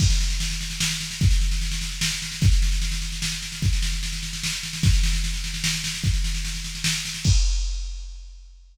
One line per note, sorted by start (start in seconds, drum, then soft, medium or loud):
0.00 kick loud
0.00 snare medium
0.00 crash loud
0.10 snare medium
0.20 snare medium
0.30 snare medium
0.40 snare medium
0.51 snare medium
0.61 snare medium
0.70 snare medium
0.80 snare loud
0.90 snare medium
1.01 snare medium
1.11 snare medium
1.21 kick loud
1.21 snare medium
1.31 snare medium
1.41 snare medium
1.51 snare medium
1.61 snare medium
1.71 snare medium
1.81 snare medium
1.92 snare medium
2.01 snare loud
2.11 snare medium
2.22 snare medium
2.32 snare medium
2.41 kick loud
2.41 snare medium
2.52 snare medium
2.62 snare medium
2.72 snare medium
2.82 snare medium
2.92 snare medium
3.02 snare medium
3.12 snare medium
3.22 snare loud
3.32 snare medium
3.42 snare medium
3.52 snare medium
3.62 kick medium
3.62 snare medium
3.73 snare medium
3.82 snare medium
3.92 snare medium
4.03 snare medium
4.13 snare medium
4.23 snare medium
4.33 snare medium
4.44 snare loud
4.53 snare medium
4.63 snare medium
4.73 snare medium
4.83 kick loud
4.83 snare medium
4.93 snare medium
5.03 snare medium
5.13 snare medium
5.24 snare medium
5.34 snare medium
5.44 snare medium
5.54 snare medium
5.64 snare loud
5.74 snare medium
5.84 snare medium
5.94 snare medium
6.04 kick medium
6.04 snare medium
6.14 snare medium
6.24 snare medium
6.34 snare medium
6.45 snare medium
6.54 snare medium
6.64 snare medium
6.75 snare medium
6.84 snare loud
6.95 snare medium
7.05 snare medium
7.14 snare medium
7.24 kick loud
7.24 crash loud